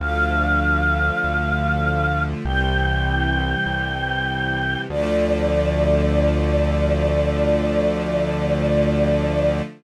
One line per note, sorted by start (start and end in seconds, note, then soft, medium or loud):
0.00 1.11 D2 medium
0.00 2.43 D3 medium
0.00 2.43 F3 medium
0.00 2.43 A3 medium
0.00 2.23 F5 loud
1.24 2.34 D2 medium
2.44 3.55 C2 loud
2.44 4.86 C3 medium
2.44 4.86 E3 medium
2.44 4.86 G3 medium
2.44 4.81 G5 medium
3.66 4.76 C2 medium
4.90 9.61 D2 loud
4.90 9.62 D3 loud
4.90 9.62 F3 loud
4.90 9.62 A3 medium
4.90 9.61 D5 loud